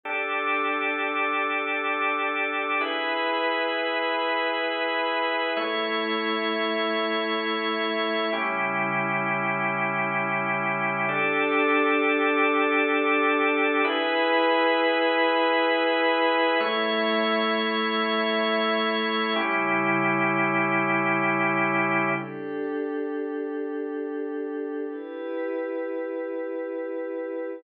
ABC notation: X:1
M:4/4
L:1/8
Q:1/4=87
K:D
V:1 name="Pad 5 (bowed)"
[DGA]8 | [E^GB]8 | [A,Ec]8 | [C,G,E]8 |
[DGA]8 | [E^GB]8 | [A,Ec]8 | [C,G,E]8 |
[DGA]8 | [EGB]8 |]
V:2 name="Drawbar Organ"
[DGA]8 | [E^GB]8 | [A,Ec]8 | [CEG]8 |
[DGA]8 | [E^GB]8 | [A,Ec]8 | [CEG]8 |
z8 | z8 |]